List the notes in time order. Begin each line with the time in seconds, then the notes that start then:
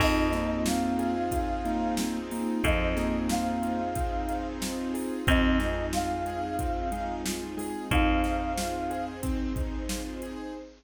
0.00 F2 C4 D#4 F4 G#4 D#5, kick, crash
0.32 A#3 D#4, snare, closed hi-hat
0.66 F4 F5, snare
0.99 G#4, closed hi-hat
1.31 F4, kick, closed hi-hat
1.65 A#3 D#4, closed hi-hat
1.97 C4, snare
2.30 A#3 D#4, open hi-hat
2.63 F2 F3 C4 D#4 F4 G#4 C5 D#5, kick, closed hi-hat
2.96 A#3 G#4, snare, closed hi-hat
3.29 F4 F5, snare
3.63 D#4, closed hi-hat
3.95 C4, kick, closed hi-hat
4.29 D#4, closed hi-hat
4.61 F4, snare
4.94 G#4, open hi-hat
5.27 F2 C4 D#4 F4 G#4 D#5, kick, closed hi-hat
5.59 G#3 D#4, snare, closed hi-hat
5.93 F4 F5, snare
6.26 G#4, closed hi-hat
6.59 C4, kick, closed hi-hat
6.92 G#3 D#4, closed hi-hat
7.25 F4, snare
7.57 G#3 G#4, open hi-hat
7.91 F2 C4 D#4 G#4 C5 F5, kick, closed hi-hat
8.24 D#4, snare, closed hi-hat
8.58 F4, snare
8.90 G#4, closed hi-hat
9.23 C4, kick, closed hi-hat
9.56 D#4, kick, closed hi-hat
9.89 F4, snare
10.22 G#4, closed hi-hat